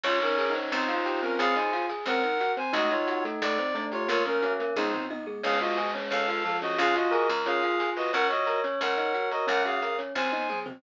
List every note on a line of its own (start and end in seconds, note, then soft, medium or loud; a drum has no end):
0.03 0.66 C#2 medium
0.03 0.20 C#4 loud
0.03 0.18 F4 medium
0.03 0.45 C#5 loud
0.03 0.20 C#5 medium
0.03 0.18 C#5 loud
0.03 crash loud
0.21 0.54 C#4 medium
0.21 0.36 D#4 medium
0.21 0.54 A#4 medium
0.21 0.36 D#5 medium
0.21 closed hi-hat medium
0.38 0.53 G#4 medium
0.38 0.53 G#5 medium
0.38 closed hi-hat medium
0.50 0.90 D#4 medium
0.55 0.70 C#4 medium
0.55 0.87 C5 medium
0.55 closed hi-hat medium
0.72 1.34 C#2 loud
0.72 0.87 C4 loud
0.72 1.21 D#4 medium
0.72 1.21 C5 medium
0.72 closed hi-hat medium
0.88 1.04 F4 medium
0.88 1.04 F5 medium
0.88 closed hi-hat medium
0.94 1.34 F4 medium
1.05 1.21 G4 medium
1.05 1.21 G5 medium
1.05 closed hi-hat medium
1.22 1.38 C4 medium
1.22 1.37 C#4 medium
1.22 1.37 A#4 medium
1.22 1.54 C5 medium
1.22 closed hi-hat medium
1.39 2.02 C#2 medium
1.39 1.54 C4 loud
1.39 1.71 G#4 medium
1.39 1.55 G#4 medium
1.39 1.55 F5 loud
1.39 closed hi-hat loud
1.56 1.71 D#4 medium
1.56 1.86 C5 medium
1.56 1.71 D#5 medium
1.56 1.86 G#5 medium
1.56 closed hi-hat medium
1.72 1.88 F4 medium
1.72 1.87 F5 medium
1.72 closed hi-hat medium
1.89 2.04 G#4 medium
1.89 2.05 G#5 medium
1.89 closed hi-hat medium
2.06 2.68 C#2 medium
2.06 2.22 C4 loud
2.06 2.52 A#4 medium
2.06 2.22 C5 medium
2.06 2.52 F#5 loud
2.06 closed hi-hat loud
2.23 2.39 D#4 medium
2.23 2.38 D#5 medium
2.23 closed hi-hat medium
2.40 2.56 F#4 medium
2.40 2.55 F#5 medium
2.40 closed hi-hat medium
2.57 2.72 C4 medium
2.57 2.72 C5 medium
2.57 2.73 C5 medium
2.57 2.73 G#5 medium
2.57 closed hi-hat medium
2.73 3.35 C#2 medium
2.73 2.90 A3 loud
2.73 3.58 D#4 medium
2.73 2.90 F#4 medium
2.73 2.89 A4 medium
2.73 2.90 D#5 loud
2.73 closed hi-hat loud
2.91 3.07 D#4 medium
2.91 3.24 F4 medium
2.91 3.24 C#5 medium
2.91 3.07 D#5 medium
2.91 closed hi-hat medium
3.07 3.23 F#4 medium
3.07 3.23 F#5 medium
3.07 closed hi-hat medium
3.25 3.40 A3 medium
3.25 3.40 A4 medium
3.25 closed hi-hat medium
3.42 4.04 C#2 medium
3.42 3.57 A3 loud
3.42 3.57 A4 medium
3.42 3.85 D5 loud
3.42 closed hi-hat loud
3.58 3.74 C4 medium
3.58 3.74 C5 medium
3.58 closed hi-hat medium
3.74 4.05 A3 medium
3.74 3.90 D4 medium
3.74 3.91 D5 medium
3.74 closed hi-hat medium
3.92 4.08 F4 medium
3.92 4.07 G4 medium
3.92 4.08 C#5 medium
3.92 4.08 G5 medium
3.92 closed hi-hat medium
4.08 4.71 C#2 medium
4.08 4.36 A#3 medium
4.08 4.24 A#3 loud
4.08 4.23 F4 loud
4.08 4.24 A#4 medium
4.08 4.23 C#5 loud
4.08 closed hi-hat loud
4.25 4.53 C#4 medium
4.25 4.41 C#4 medium
4.25 4.53 A#4 medium
4.25 4.41 C#5 medium
4.25 closed hi-hat medium
4.42 4.71 C#4 medium
4.42 4.58 F#4 medium
4.42 4.58 F#5 medium
4.42 closed hi-hat medium
4.59 4.75 A#3 medium
4.59 4.74 A#4 medium
4.59 closed hi-hat medium
4.76 5.38 C#2 medium
4.76 4.92 G#3 loud
4.76 5.05 D#4 medium
4.76 4.91 D#4 medium
4.76 4.92 G#4 medium
4.76 5.05 C5 medium
4.76 kick medium
4.76 high tom medium
4.93 5.08 C4 medium
4.93 5.08 C5 medium
4.93 floor tom medium
5.10 5.25 D#4 medium
5.10 5.26 D#5 medium
5.10 high tom medium
5.26 5.42 G#3 medium
5.26 5.42 G#4 medium
5.43 6.06 C#2 medium
5.43 6.39 G#3 medium
5.43 5.59 C#4 loud
5.43 5.59 G#4 medium
5.43 5.58 C#5 medium
5.43 5.59 F5 loud
5.43 crash loud
5.60 5.76 F4 medium
5.60 5.91 F#4 medium
5.60 5.91 D#5 medium
5.60 5.76 F5 medium
5.60 closed hi-hat medium
5.77 5.93 G#4 medium
5.77 5.92 G#5 medium
5.77 closed hi-hat medium
5.94 6.10 C#4 medium
5.94 6.10 C#5 medium
5.94 closed hi-hat medium
6.11 6.73 C#2 medium
6.11 6.26 C#4 loud
6.11 6.57 A4 medium
6.11 6.27 C#5 medium
6.11 6.57 F5 loud
6.11 closed hi-hat medium
6.28 6.43 F4 medium
6.28 6.44 F5 medium
6.28 closed hi-hat medium
6.45 6.75 F3 medium
6.45 6.60 A4 medium
6.45 6.60 A5 medium
6.45 closed hi-hat medium
6.62 6.77 C#4 medium
6.62 6.78 F#4 medium
6.62 6.94 C#5 medium
6.62 6.78 D#5 medium
6.62 open hi-hat medium
6.78 7.27 C#2 loud
6.78 6.94 C#4 loud
6.78 7.10 F4 medium
6.78 6.95 G#4 loud
6.78 6.95 F5 loud
6.78 closed hi-hat loud
6.95 7.11 F4 medium
6.95 7.28 F#4 medium
6.95 7.28 D#5 medium
6.95 7.11 F5 medium
6.95 closed hi-hat medium
7.11 7.28 G#4 medium
7.11 7.41 A#4 medium
7.11 7.27 G#5 medium
7.11 closed hi-hat medium
7.29 8.08 C#2 medium
7.29 7.44 A#4 medium
7.29 7.45 A#5 medium
7.29 closed hi-hat medium
7.46 7.61 C#4 loud
7.46 8.04 F4 medium
7.46 7.90 G#4 medium
7.46 7.62 C#5 medium
7.46 7.90 F5 loud
7.46 closed hi-hat medium
7.62 7.78 F4 medium
7.62 7.78 F5 medium
7.62 closed hi-hat medium
7.80 7.95 G#4 medium
7.80 7.95 G#5 medium
7.80 closed hi-hat medium
7.96 8.11 F#4 medium
7.96 8.12 B4 medium
7.96 8.11 D#5 medium
7.96 8.11 B5 medium
7.96 open hi-hat medium
8.13 8.76 C#2 medium
8.13 8.29 C#4 loud
8.13 8.27 A#4 loud
8.13 8.28 C#5 medium
8.13 9.45 C#5 medium
8.13 8.27 F#5 loud
8.13 closed hi-hat medium
8.30 8.60 F#4 medium
8.30 8.46 F#4 medium
8.30 8.60 D#5 medium
8.30 8.46 F#5 medium
8.30 closed hi-hat medium
8.46 8.62 A#4 medium
8.46 8.62 A#5 medium
8.46 closed hi-hat medium
8.64 8.79 C#4 medium
8.64 8.79 C#5 medium
8.64 closed hi-hat medium
8.81 9.43 C#2 medium
8.81 8.96 C#4 loud
8.81 9.29 A#4 medium
8.81 8.96 C#5 medium
8.81 9.29 F#5 medium
8.81 closed hi-hat loud
8.97 9.13 D#4 medium
8.97 9.13 D#5 medium
8.97 closed hi-hat medium
9.14 9.30 F#4 medium
9.14 9.29 F#5 medium
9.14 closed hi-hat medium
9.31 9.46 F#4 medium
9.31 9.47 A#4 medium
9.31 9.46 D#5 medium
9.31 9.47 A#5 medium
9.31 closed hi-hat medium
9.47 10.10 C#2 medium
9.47 9.77 C#4 medium
9.47 9.63 C#4 medium
9.47 9.62 A#4 medium
9.47 9.63 C#5 medium
9.47 9.62 F#5 loud
9.47 closed hi-hat loud
9.65 9.80 F#4 medium
9.65 9.96 G#4 medium
9.65 9.96 F5 medium
9.65 9.81 F#5 medium
9.65 closed hi-hat medium
9.82 9.97 A#4 medium
9.82 9.97 A#5 medium
9.82 closed hi-hat medium
9.98 10.14 C#4 medium
9.98 10.13 C#5 medium
9.98 closed hi-hat medium
10.15 10.77 C#2 medium
10.15 10.31 C4 loud
10.15 10.59 C5 medium
10.15 10.31 C5 medium
10.15 10.59 G#5 medium
10.15 kick medium
10.15 snare medium
10.32 10.48 D#4 medium
10.32 10.47 D#5 medium
10.32 high tom medium
10.49 10.65 G#4 medium
10.49 10.65 G#5 medium
10.49 mid tom medium
10.66 10.81 C4 medium
10.66 10.81 C5 medium
10.66 floor tom loud